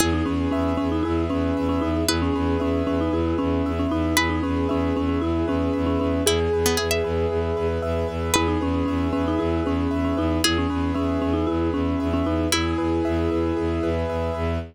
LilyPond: <<
  \new Staff \with { instrumentName = "Marimba" } { \time 4/4 \key e \major \tempo 4 = 115 e'16 dis'16 cis'8 cis'8 cis'16 dis'16 e'8 cis'8. cis'16 dis'8 | e'16 cis'16 cis'8 cis'8 cis'16 dis'16 e'8 cis'8. cis'16 dis'8 | e'16 dis'16 cis'8 cis'8 cis'16 cis'16 e'8 cis'8. cis'16 cis'8 | gis'2. r4 |
e'16 dis'16 cis'8 cis'8 cis'16 dis'16 e'8 cis'8. cis'16 dis'8 | e'16 cis'16 cis'8 cis'8 cis'16 dis'16 e'8 cis'8. cis'16 dis'8 | e'2. r4 | }
  \new Staff \with { instrumentName = "Pizzicato Strings" } { \time 4/4 \key e \major gis'1 | b'1 | b'1 | e'16 r8 b16 gis'16 e''4~ e''16 r4. |
b'1 | gis'1 | e'2~ e'8 r4. | }
  \new Staff \with { instrumentName = "Acoustic Grand Piano" } { \time 4/4 \key e \major gis'8 b'8 e''8 b'8 gis'8 b'8 e''8 b'8 | gis'8 b'8 e''8 b'8 gis'8 b'8 e''8 b'8 | gis'8 b'8 e''8 b'8 gis'8 b'8 e''8 b'8 | gis'8 b'8 e''8 b'8 gis'8 b'8 e''8 b'8 |
gis'8 b'8 e''8 b'8 gis'8 b'8 e''8 b'8 | gis'8 b'8 e''8 b'8 gis'8 b'8 e''8 b'8 | gis'8 b'8 e''8 b'8 gis'8 b'8 e''8 b'8 | }
  \new Staff \with { instrumentName = "Violin" } { \clef bass \time 4/4 \key e \major e,8 e,8 e,8 e,8 e,8 e,8 e,8 e,8 | e,8 e,8 e,8 e,8 e,8 e,8 e,8 e,8 | e,8 e,8 e,8 e,8 e,8 e,8 e,8 e,8 | e,8 e,8 e,8 e,8 e,8 e,8 e,8 e,8 |
e,8 e,8 e,8 e,8 e,8 e,8 e,8 e,8 | e,8 e,8 e,8 e,8 e,8 e,8 e,8 e,8 | e,8 e,8 e,8 e,8 e,8 e,8 e,8 e,8 | }
>>